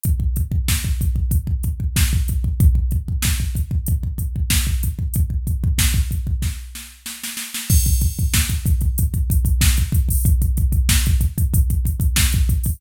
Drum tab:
CC |----------------|----------------|----------------|x---------------|
HH |x-x---x-x-x---x-|x-x---x-x-x---x-|x-x---x---------|-xxx-xxxxxxx-xxo|
SD |----o-------o---|----o-------o---|----o---o-o-oooo|----o-------o---|
BD |oooooooooooooooo|oooooooooooooooo|ooooooooo-------|oooooooooooooooo|

CC |----------------|
HH |xxxx-xxxxxxx-xxo|
SD |----o-------o---|
BD |oooooooooooooooo|